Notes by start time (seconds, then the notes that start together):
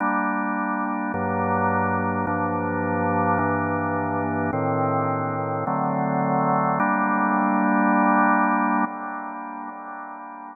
0.00 G3 A#3 D4
1.14 G2 F#3 A#3 D4
2.27 G2 F3 A#3 D4
3.39 G2 E3 A#3 D4
4.53 A2 D#3 C4
5.67 D3 F#3 A3 C4
6.80 G3 A#3 D4